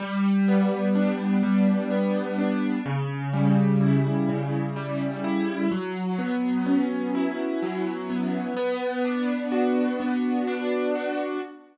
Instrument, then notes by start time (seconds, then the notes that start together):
acoustic grand piano
0.00 G3
0.48 B3
0.95 D4
1.43 G3
1.90 B3
2.38 D4
2.86 C#3
3.33 G3
3.81 E4
4.29 C#3
4.76 G3
5.24 E4
5.71 F#3
6.18 B3
6.66 C#4
7.15 E4
7.62 F#3
8.10 B3
8.57 B3
9.05 D4
9.52 F#4
10.00 B3
10.47 D4
10.95 F#4